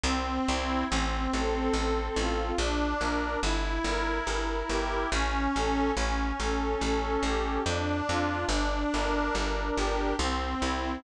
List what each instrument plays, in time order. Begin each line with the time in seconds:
0.04 electric bass (finger) C2, accordion C4
0.48 electric bass (finger) C2, accordion E4
0.89 electric bass (finger) A1, accordion C4
1.32 electric bass (finger) A1, accordion A4
1.73 electric bass (finger) A1, accordion C4
2.16 electric bass (finger) A1, accordion F4
2.58 electric bass (finger) A#1, accordion D4
3.01 electric bass (finger) A#1, accordion A#4
3.43 electric bass (finger) G1, accordion E4
3.84 electric bass (finger) G1, accordion A#4
4.27 electric bass (finger) G1, accordion E4
4.69 electric bass (finger) G1, accordion G4
5.11 electric bass (finger) A1, accordion C#4
5.54 electric bass (finger) A1, accordion A4
5.96 electric bass (finger) A1, accordion C#4
6.40 electric bass (finger) A1, accordion A4
6.81 electric bass (finger) A1, accordion C#4
7.23 electric bass (finger) A1, accordion G4
7.65 electric bass (finger) F2, accordion D4
8.09 electric bass (finger) F2, accordion F4
8.49 electric bass (finger) G1, accordion D4
8.93 electric bass (finger) G1, accordion A#4
9.35 electric bass (finger) G1, accordion D4
9.76 electric bass (finger) G1, accordion G4
10.19 electric bass (finger) C2, accordion C4
10.60 electric bass (finger) C2, accordion E4